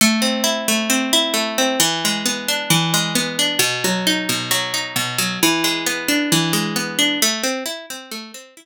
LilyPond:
\new Staff { \time 4/4 \key a \minor \tempo 4 = 133 a8 c'8 e'8 a8 c'8 e'8 a8 c'8 | e8 gis8 b8 d'8 e8 gis8 b8 d'8 | b,8 fis8 dis'8 b,8 fis8 dis'8 b,8 fis8 | e8 gis8 b8 d'8 e8 gis8 b8 d'8 |
a8 c'8 e'8 c'8 a8 c'8 e'8 r8 | }